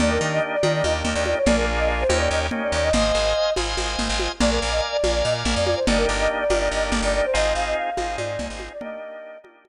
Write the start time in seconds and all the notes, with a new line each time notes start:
0.00 D#2 A#3 D4 D#4 G4 D5, low conga
0.11 A#4
0.21 D#3
0.33 D#5
0.53 D5
0.63 D#3 A#3 D4 D#4 G4, high conga
0.74 D5
0.83 D#2 D#5, high conga
1.04 D#2, low conga
1.14 D#2 D5
1.26 D5, high conga
1.37 C#5
1.46 A#1 A#3 D4 F4 G#4 D5, low conga
1.55 A#4
1.79 D#5
2.01 C5
2.09 D#2 A#3 C#4 D#4 G4, high conga
2.19 D5
2.30 D#2 D#5
2.51 A#3 C#4 D#4 G4, low conga
2.62 D5
2.72 D#2 D5
2.83 D#5
2.93 G#1 C5 D#5 F5 G#5, low conga
3.15 G#1
3.56 G#1 C5 D#5 F5 G#5, high conga
3.77 G#1, high conga
3.99 G#1, low conga
4.09 G#1
4.19 high conga
4.40 A#1 A#4 D5 F5 G#5, low conga
4.50 A#4
4.62 A#1
4.71 D#5
4.92 D5
5.04 A#1 A#4 D5 F5 G#5, high conga
5.14 D5
5.24 A#2 D#5
5.45 A#1, low conga
5.55 F2 D5
5.65 D5, high conga
5.76 C5
5.87 G1 A#3 D4 D#4 G4 D5, low conga
5.98 A#4
6.09 G1
6.20 D#5
6.40 D5
6.50 G1 A#3 D4 D#4 G4, high conga
6.59 D5
6.71 G1 D#5
6.92 G1, low conga
7.02 G1 D5
7.15 D5
7.25 C5
7.33 G#1 C4 D#4 F4 G#4 D#5
7.55 G#1 F5
7.66 D#5
7.77 F5
7.97 G#1 C4 D#4 F4 G#4, high conga
8.17 G#2 D5, high conga
8.39 C2, low conga
8.50 G#1
8.60 high conga
8.73 D5
8.81 A#3 D4 D#4 G4 D#5, low conga
9.44 A#3 D4 D#4 G4, high conga
9.65 high conga